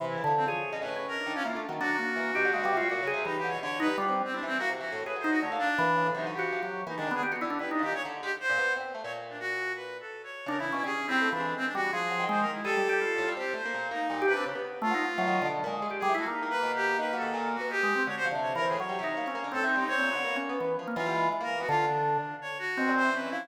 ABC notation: X:1
M:5/4
L:1/16
Q:1/4=166
K:none
V:1 name="Drawbar Organ"
(3E,4 D,4 _A4 (3_D4 D4 =D4 (3_B,2 D2 _E,2 | D2 _B,4 G2 (3_A,2 G,2 F2 _G2 _A2 E,4 | z2 _E z G,3 z =E2 z6 _A2 _E2 | A,2 z2 E,4 (3_G,4 _G4 G,4 (3E,2 _E,2 B,2 |
G _G E D (3E2 _E2 _E,2 z12 | z16 (3D2 E,2 _D2 | (3_D4 E4 E,4 z2 G,2 F,4 _A,2 z2 | (3_A2 G,2 G2 F4 z8 (3G,2 G2 D2 |
z4 (3A,2 _E2 F2 (3_G,4 D,4 _A,4 (3=G2 =G,2 =E2 | _B,16 (3_A2 _A,2 C2 | (3_G4 D,4 E,4 (3_G,4 _E4 _D4 C4 | (3C4 B,4 _D4 E,2 z _B, E,4 E,4 |
D,6 z6 C4 _D4 |]
V:2 name="Pizzicato Strings"
C,2 _D, F,2 F,2 z B,, A,,3 z2 _E, F, (3=E,2 A,2 _G,2 | _G,2 z2 E,2 B,, D, _D, B, C, =G, (3_B,,2 D,2 C,2 G,2 =D, =B,, | (3D,4 G,4 C4 C E,2 _B, (3C,2 E,2 A,,2 A,, _G,3 | D, _B,2 z B, z _D, A,, (3C,2 =D,2 F,2 F, z3 B, _A, D,2 |
z B, D,2 G,2 _B,,3 D,2 _A, z2 B,, =B,2 C2 =A, | _B,,12 z4 _D,3 =B,, | G, z2 G, A, F, _A,8 _G, _E,5 | G,6 A,, G, C2 A, _B, _B,,2 B,2 B,,2 C, C |
_D, B,3 z _G, z2 E, _E,2 B,,2 _B,,2 _A,3 =E, =A, | z2 _B,2 =B,,4 (3_E,2 _G,2 E,2 _B,,3 =B, z4 | D,2 F, C,3 C A,, z G, C,2 _B, C B, D, (3A,,2 E,2 G,2 | C _B,,2 D, _B,3 =B,3 F, z _G, =G, _A,3 _B,2 =B, |
D,2 z10 B,, _B,,2 E,3 F,2 |]
V:3 name="Clarinet"
z E3 C _d4 B3 _B3 _D F2 z2 | _G16 (3_E2 =G2 _d2 | _d2 B2 F z2 C (3=D2 C2 _G2 z G3 (3B2 c2 G2 | _d2 =D6 _E2 G6 E D2 _A |
z4 (3B2 D2 G2 _d z2 G z c4 z3 | _d z2 =D _G4 (3B4 A4 _d4 _B E2 E | (3_A4 C4 D4 C D _G2 A4 (3c2 _B2 E2 | A8 G2 c4 _E4 B2 |
z4 F8 z5 _A2 _G | (3_E4 B4 G4 B2 A4 _G2 =G4 | _d c z2 (3d2 _B2 _A2 d8 (3=A2 _E2 E2 | _d6 z6 F4 z _B2 _G |
F2 D6 _d2 _G4 c2 B2 E2 |]